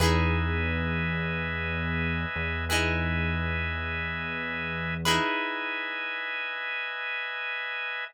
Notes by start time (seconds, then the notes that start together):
0.00 E2 D#4 E4 G#4 B4 D#5 E5 G#5
2.36 E2
2.69 D#4 E4 G#4 B4 D#5 E5 G#5
5.05 D#4 E4 G#4 B4 D#5 E5 G#5